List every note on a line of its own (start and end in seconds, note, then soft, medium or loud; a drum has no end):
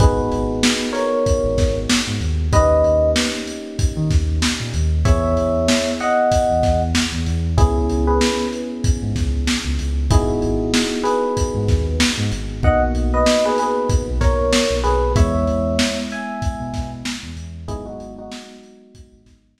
0.00 0.29 G#1 loud
0.00 2.48 B3 medium
0.00 2.48 D#4 medium
0.00 2.48 F#4 medium
0.00 2.48 G#4 medium
0.00 0.90 G#4 medium
0.00 0.90 B4 medium
0.00 kick loud
0.00 closed hi-hat medium
0.32 0.61 G#1 medium
0.32 closed hi-hat medium
0.63 snare loud
0.93 1.76 A#4 medium
0.93 1.76 C#5 medium
0.93 snare soft
0.93 closed hi-hat medium
1.26 kick medium
1.26 closed hi-hat medium
1.44 1.56 G#1 loud
1.58 1.86 G#1 medium
1.58 kick medium
1.58 snare medium
1.58 closed hi-hat medium
1.89 snare loud
2.07 2.20 G#2 medium
2.21 2.49 D#2 medium
2.21 closed hi-hat medium
2.53 2.81 D#2 medium
2.53 5.01 A#3 medium
2.53 5.01 C#4 medium
2.53 5.01 D#4 medium
2.53 5.01 G4 medium
2.53 3.10 B4 medium
2.53 3.10 D#5 medium
2.53 kick medium
2.53 closed hi-hat medium
2.84 3.13 D#2 medium
2.84 closed hi-hat medium
3.16 snare loud
3.47 closed hi-hat medium
3.79 kick medium
3.79 closed hi-hat medium
3.97 4.09 D#3 medium
4.11 4.39 D#2 medium
4.11 kick medium
4.11 snare soft
4.11 closed hi-hat medium
4.42 snare medium
4.60 4.73 A#2 medium
4.74 5.03 D#2 loud
4.74 closed hi-hat medium
5.05 5.34 E2 medium
5.05 7.54 B3 medium
5.05 7.54 E4 medium
5.05 7.54 G#4 medium
5.05 5.90 C#5 medium
5.05 5.90 E5 medium
5.05 kick medium
5.05 closed hi-hat medium
5.37 5.66 E2 medium
5.37 closed hi-hat medium
5.68 snare medium
6.00 6.80 D#5 medium
6.00 6.80 F#5 medium
6.00 closed hi-hat medium
6.32 kick medium
6.32 closed hi-hat medium
6.49 6.62 E2 medium
6.63 6.92 E2 loud
6.63 kick medium
6.63 snare soft
6.63 closed hi-hat medium
6.95 snare medium
7.12 7.25 E2 medium
7.26 7.56 E2 loud
7.26 closed hi-hat medium
7.58 7.87 C#2 loud
7.58 10.06 B3 medium
7.58 10.06 C#4 medium
7.58 8.05 E4 medium
7.58 10.06 E4 medium
7.58 8.05 G#4 medium
7.58 10.06 G#4 medium
7.58 kick medium
7.58 closed hi-hat medium
7.89 8.18 C#2 medium
7.89 closed hi-hat medium
8.07 8.48 G#4 medium
8.07 8.48 B4 medium
8.21 snare medium
8.53 closed hi-hat medium
8.84 kick medium
8.84 closed hi-hat medium
9.02 9.14 G#2 medium
9.16 9.45 C#2 medium
9.16 kick medium
9.16 snare soft
9.16 closed hi-hat medium
9.47 snare medium
9.65 9.77 C#2 medium
9.79 10.08 C#2 medium
9.79 closed hi-hat medium
10.11 10.39 G#1 loud
10.11 12.59 B3 medium
10.11 12.59 D#4 medium
10.11 11.03 E4 medium
10.11 12.59 F#4 medium
10.11 12.59 G#4 medium
10.11 11.03 G#4 medium
10.11 kick medium
10.11 closed hi-hat loud
10.42 10.71 G#1 medium
10.42 closed hi-hat medium
10.74 snare medium
11.03 11.85 G#4 medium
11.03 11.85 B4 medium
11.03 closed hi-hat medium
11.37 kick medium
11.37 closed hi-hat medium
11.54 11.67 G#2 medium
11.68 11.97 D#2 medium
11.68 kick medium
11.68 snare soft
11.68 closed hi-hat medium
12.00 snare loud
12.18 12.30 G#2 loud
12.32 12.61 G#1 medium
12.32 closed hi-hat medium
12.63 12.92 B1 medium
12.63 15.11 A#3 medium
12.63 15.11 B3 medium
12.63 15.11 D#4 medium
12.63 15.11 F#4 medium
12.63 12.81 D#5 medium
12.63 12.81 F#5 medium
12.63 kick medium
12.94 13.23 B1 medium
12.94 closed hi-hat medium
13.14 13.44 B4 medium
13.14 13.44 D#5 medium
13.26 snare medium
13.45 13.59 G#4 medium
13.45 13.59 B4 medium
13.58 13.89 G#4 medium
13.58 13.89 B4 medium
13.58 closed hi-hat medium
13.89 kick medium
13.89 closed hi-hat medium
14.07 14.19 B1 medium
14.21 14.50 B1 medium
14.21 14.75 A#4 medium
14.21 14.75 C#5 medium
14.21 kick medium
14.21 snare soft
14.21 closed hi-hat medium
14.53 snare loud
14.70 14.83 B1 medium
14.84 15.13 B1 medium
14.84 15.13 G#4 medium
14.84 15.13 B4 medium
14.84 closed hi-hat medium
15.16 15.44 E2 loud
15.16 17.64 G#3 medium
15.16 17.64 B3 medium
15.16 17.64 E4 medium
15.16 15.98 C#5 medium
15.16 15.98 E5 medium
15.16 kick medium
15.16 closed hi-hat medium
15.47 15.77 E2 medium
15.47 closed hi-hat medium
15.79 snare loud
16.11 16.90 E5 medium
16.11 16.90 G#5 medium
16.11 closed hi-hat medium
16.42 kick medium
16.42 closed hi-hat medium
16.60 16.72 B2 medium
16.74 17.02 B2 medium
16.74 kick medium
16.74 snare soft
16.74 closed hi-hat medium
17.05 snare loud
17.23 17.35 E2 medium
17.36 17.65 E2 medium
17.36 closed hi-hat medium
17.68 17.97 G#1 loud
17.68 19.60 F#3 medium
17.68 19.60 G#3 medium
17.68 19.60 B3 medium
17.68 19.60 D#4 medium
17.68 17.85 E4 medium
17.68 17.85 G#4 loud
17.68 kick medium
17.68 closed hi-hat medium
17.86 18.13 D#4 medium
17.86 18.13 F#4 medium
18.00 18.29 G#1 medium
18.00 closed hi-hat medium
18.18 19.21 D#4 medium
18.18 19.21 F#4 medium
18.32 snare loud
18.63 closed hi-hat medium
18.95 kick medium
18.95 closed hi-hat medium
19.12 19.25 G#1 medium
19.26 19.55 G#1 medium
19.26 kick medium
19.26 snare soft
19.26 closed hi-hat medium
19.58 snare medium